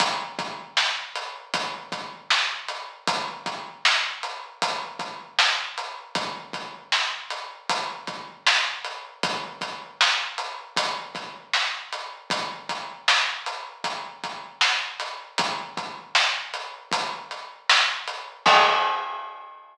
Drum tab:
CC |--------|--------|--------|--------|
HH |xx-xxx-x|xx-xxx-x|xx-xxx-x|xx-xxx-x|
SD |--o---o-|--o---o-|--o---o-|--o--oo-|
BD |oo--oo--|oo--oo--|oo--oo--|oo--oo--|

CC |--------|--------|x-------|
HH |xx-xxx-x|xx-xxx-x|--------|
SD |--o---oo|--o---o-|--------|
BD |oo--oo--|oo--o---|o-------|